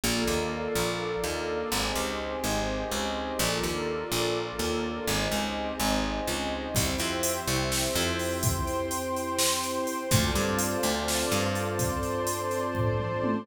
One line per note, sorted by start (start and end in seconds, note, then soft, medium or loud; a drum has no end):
0.04 0.24 A#1 medium
0.04 1.70 A#3 medium
0.04 1.70 D4 medium
0.04 1.70 F4 loud
0.04 1.70 A4 medium
0.04 1.70 A#4 medium
0.04 1.70 D5 medium
0.04 1.70 F5 medium
0.28 0.68 D#2 medium
0.75 1.16 A#1 medium
1.24 1.64 D#2 medium
1.71 1.92 G#1 medium
1.71 3.38 C4 medium
1.71 3.38 D#4 medium
1.71 3.38 G4 medium
1.71 3.38 G#4 medium
1.71 3.38 C5 medium
1.71 3.38 D#5 medium
1.96 2.36 C#2 medium
2.44 2.85 G#1 medium
2.92 3.32 C#2 medium
3.39 3.60 A#1 medium
3.39 5.06 A#3 medium
3.39 5.06 D4 medium
3.39 5.06 F4 medium
3.39 5.06 F4 loud
3.39 5.06 A4 medium
3.39 5.06 A#4 medium
3.39 5.06 D5 medium
3.63 4.04 D#2 medium
4.12 4.52 A#1 medium
4.59 5.00 D#2 medium
5.07 5.28 G#1 medium
5.07 6.74 C4 medium
5.07 6.74 D#4 loud
5.07 6.74 G4 medium
5.07 6.74 G4 loud
5.07 6.74 G#4 medium
5.07 6.74 C5 medium
5.07 6.74 D#5 medium
5.32 5.72 C#2 medium
5.80 6.20 G#1 medium
6.27 6.68 C#2 medium
6.75 6.96 C2 medium
6.75 10.08 C4 loud
6.75 10.08 E4 loud
6.75 10.08 G4 medium
6.75 8.42 C5 medium
6.75 8.42 E5 medium
6.75 8.42 G5 medium
6.75 kick loud
6.75 closed hi-hat loud
6.98 7.40 F2 medium
6.98 closed hi-hat medium
7.23 closed hi-hat loud
7.48 7.88 C2 medium
7.48 closed hi-hat medium
7.72 snare loud
7.96 9.79 F2 medium
7.96 closed hi-hat medium
8.19 open hi-hat medium
8.43 10.09 C5 medium
8.43 10.09 G5 medium
8.43 10.09 C6 loud
8.43 kick loud
8.43 closed hi-hat loud
8.67 closed hi-hat medium
8.91 closed hi-hat loud
9.16 closed hi-hat medium
9.38 snare loud
9.63 closed hi-hat medium
9.87 closed hi-hat medium
10.11 10.32 D2 medium
10.11 13.44 C4 loud
10.11 13.44 D4 medium
10.11 13.44 F4 loud
10.11 13.44 A4 loud
10.11 11.78 C5 medium
10.11 11.78 D5 medium
10.11 11.78 F5 medium
10.11 11.78 A5 medium
10.11 kick loud
10.11 closed hi-hat loud
10.35 10.76 G2 medium
10.35 closed hi-hat medium
10.59 closed hi-hat loud
10.83 11.24 D2 medium
10.83 closed hi-hat medium
11.08 snare loud
11.31 13.15 G2 medium
11.31 closed hi-hat medium
11.55 closed hi-hat medium
11.79 13.46 C5 loud
11.79 13.46 D5 medium
11.79 13.46 A5 medium
11.79 13.46 C6 medium
11.79 kick loud
11.79 closed hi-hat loud
12.03 closed hi-hat medium
12.27 closed hi-hat loud
12.51 closed hi-hat medium
12.75 kick medium
12.75 floor tom medium
12.99 mid tom medium
13.24 high tom loud